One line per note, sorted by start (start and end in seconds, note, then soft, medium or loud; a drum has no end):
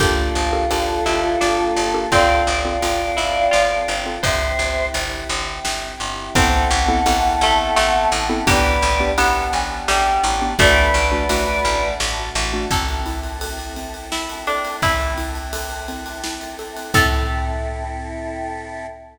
0.00 0.30 G1 medium
0.00 2.10 A#3 medium
0.00 0.42 D4 loud
0.00 2.10 D4 medium
0.00 2.00 F4 medium
0.00 0.42 G4 loud
0.00 0.95 G4 medium
0.00 2.10 G4 medium
0.00 0.42 A4 medium
0.00 2.10 A4 medium
0.00 2.00 A4 medium
0.00 0.42 A#4 loud
0.00 kick loud
0.00 crash medium
0.35 0.65 G1 medium
0.35 ride medium
0.53 0.67 D4 medium
0.53 0.67 G4 medium
0.53 0.67 A4 medium
0.53 0.67 A#4 medium
0.71 1.01 G1 medium
0.71 1.27 D4 medium
0.71 1.27 G4 medium
0.71 1.27 A4 medium
0.71 1.27 A#4 medium
0.71 ride medium
1.06 1.36 G1 medium
1.06 1.38 E4 medium
1.06 ride medium
1.41 1.71 G1 medium
1.41 2.02 D4 medium
1.41 snare medium
1.76 2.06 G1 medium
1.76 ride medium
1.94 2.08 D4 medium
1.94 2.08 G4 medium
1.94 2.08 A4 medium
1.94 2.08 A#4 medium
2.11 2.42 G1 loud
2.11 4.21 C4 medium
2.11 2.54 C4 medium
2.11 3.15 C4 loud
2.11 4.21 F4 medium
2.11 2.54 F4 medium
2.11 4.21 A4 medium
2.11 2.54 A4 medium
2.11 3.93 D5 medium
2.11 3.93 F5 medium
2.11 kick medium
2.11 ride medium
2.47 2.77 G1 medium
2.47 ride medium
2.65 2.79 C4 medium
2.65 2.79 F4 medium
2.65 2.79 A4 medium
2.82 3.12 G1 medium
2.82 3.39 C4 medium
2.82 3.39 F4 medium
2.82 3.39 A4 medium
2.82 ride medium
3.17 3.48 G1 medium
3.17 3.50 E4 medium
3.17 ride medium
3.51 3.83 G1 medium
3.51 4.20 F4 medium
3.51 snare medium
3.88 4.18 G1 medium
3.88 ride medium
4.06 4.20 C4 medium
4.06 4.20 F4 medium
4.06 4.20 A4 medium
4.23 4.54 G1 loud
4.23 6.33 C4 medium
4.23 6.33 E4 medium
4.23 6.33 G4 medium
4.23 5.16 C5 loud
4.23 4.85 C5 medium
4.23 4.85 E5 medium
4.23 kick medium
4.23 ride loud
4.59 4.89 G1 medium
4.59 ride medium
4.94 5.24 G1 medium
4.94 ride medium
5.29 5.59 G1 loud
5.29 ride medium
5.65 5.95 G1 medium
5.65 snare loud
6.00 6.30 G1 medium
6.00 ride medium
6.35 6.65 A1 loud
6.35 8.45 B3 medium
6.35 6.78 B3 loud
6.35 8.45 C4 medium
6.35 6.78 C4 loud
6.35 7.28 C4 loud
6.35 8.45 E4 medium
6.35 6.78 E4 loud
6.35 8.45 A4 medium
6.35 6.78 A4 loud
6.35 8.35 F#5 medium
6.35 8.35 A5 medium
6.35 kick loud
6.35 ride loud
6.71 7.01 A1 loud
6.71 ride medium
6.88 7.02 B3 loud
6.88 7.02 C4 medium
6.88 7.02 E4 medium
6.88 7.02 A4 loud
7.06 7.36 A1 medium
7.06 7.62 B3 medium
7.06 7.62 C4 medium
7.06 7.62 E4 medium
7.06 7.62 A4 medium
7.06 ride loud
7.41 7.71 A1 medium
7.41 7.75 A3 loud
7.41 ride medium
7.76 8.06 A1 loud
7.76 8.38 A3 medium
7.76 snare loud
8.12 8.42 A1 loud
8.12 ride medium
8.29 8.43 B3 medium
8.29 8.43 C4 loud
8.29 8.43 E4 loud
8.29 8.43 A4 medium
8.47 8.77 A1 loud
8.47 8.89 B3 loud
8.47 10.57 B3 medium
8.47 8.89 D4 loud
8.47 10.57 D4 medium
8.47 8.89 G4 loud
8.47 9.12 G4 loud
8.47 10.57 G4 medium
8.47 9.10 B4 medium
8.47 9.10 D5 medium
8.47 kick loud
8.47 ride loud
8.82 9.12 A1 loud
8.82 ride medium
9.00 9.14 B3 medium
9.00 9.14 D4 medium
9.00 9.14 G4 medium
9.18 9.48 A1 loud
9.18 9.74 B3 loud
9.18 9.76 B3 loud
9.18 9.74 D4 medium
9.18 9.74 G4 medium
9.18 ride loud
9.35 9.52 F#5 medium
9.53 9.83 A1 medium
9.53 9.84 G#5 medium
9.53 ride medium
9.88 10.18 A1 medium
9.88 10.22 G3 medium
9.88 10.51 G5 medium
9.88 snare loud
10.24 10.54 A1 loud
10.24 ride medium
10.41 10.55 B3 medium
10.41 10.55 D4 medium
10.41 10.55 G4 medium
10.58 10.89 A1 loud
10.58 12.68 A3 medium
10.58 11.01 A3 loud
10.58 11.61 A3 loud
10.58 12.68 D4 medium
10.58 11.01 D4 loud
10.58 12.68 F#4 medium
10.58 11.01 F#4 loud
10.58 11.88 B4 medium
10.58 11.88 D5 medium
10.58 kick loud
10.58 ride loud
10.94 11.24 A1 medium
10.94 ride medium
11.12 11.26 A3 medium
11.12 11.26 D4 medium
11.12 11.26 F#4 medium
11.29 11.59 A1 medium
11.29 11.86 A3 loud
11.29 11.86 D4 medium
11.29 11.86 F#4 loud
11.29 ride loud
11.65 11.95 A1 medium
11.65 ride medium
12.00 12.30 A1 loud
12.00 snare loud
12.35 12.65 A1 loud
12.35 ride medium
12.53 12.67 A3 medium
12.53 12.67 D4 medium
12.53 12.67 F#4 medium
12.71 14.65 A1 medium
12.71 13.02 C4 loud
12.71 16.90 C4 medium
12.71 16.90 E4 medium
12.71 16.90 A4 medium
12.71 13.00 A4 medium
12.71 kick medium
12.71 crash medium
12.88 ride medium
13.06 13.38 E4 medium
13.06 ride medium
13.23 ride medium
13.41 13.73 A4 medium
13.41 ride loud
13.59 ride medium
13.76 14.08 C4 medium
13.76 ride medium
13.94 ride medium
14.12 14.42 E4 medium
14.12 14.44 E4 medium
14.12 snare loud
14.29 ride medium
14.47 14.76 D4 medium
14.47 14.79 A4 medium
14.47 ride medium
14.65 ride medium
14.82 16.77 A1 medium
14.82 15.14 C4 medium
14.82 16.47 E4 medium
14.82 kick medium
14.82 ride medium
15.00 ride medium
15.18 15.49 E4 medium
15.18 ride medium
15.35 ride medium
15.53 15.85 A4 medium
15.53 ride loud
15.71 ride medium
15.88 16.20 C4 medium
15.88 ride medium
16.06 ride medium
16.24 16.55 E4 medium
16.24 snare loud
16.41 ride medium
16.59 16.91 A4 medium
16.59 ride medium
16.76 ride medium
16.93 18.87 A2 loud
16.93 18.86 C4 loud
16.93 18.86 E4 loud
16.93 18.86 A4 medium
16.93 18.86 A4 loud
16.93 18.87 A4 loud
16.93 kick loud
16.93 crash loud